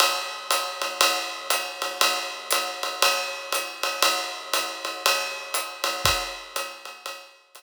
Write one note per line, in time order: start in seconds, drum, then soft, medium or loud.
0.00 ride medium
0.51 hi-hat pedal medium
0.51 ride medium
0.82 ride medium
1.01 ride loud
1.50 hi-hat pedal medium
1.50 ride medium
1.82 ride medium
2.01 ride medium
2.51 hi-hat pedal medium
2.51 ride medium
2.83 ride medium
3.02 ride medium
3.52 hi-hat pedal medium
3.52 ride medium
3.83 ride medium
4.02 ride medium
4.53 hi-hat pedal medium
4.53 ride medium
4.85 ride medium
5.06 ride medium
5.54 hi-hat pedal medium
5.54 ride medium
5.84 ride medium
6.05 kick medium
6.05 ride medium
6.56 hi-hat pedal medium
6.56 ride medium
6.85 ride medium
7.06 ride medium
7.55 hi-hat pedal medium
7.55 ride medium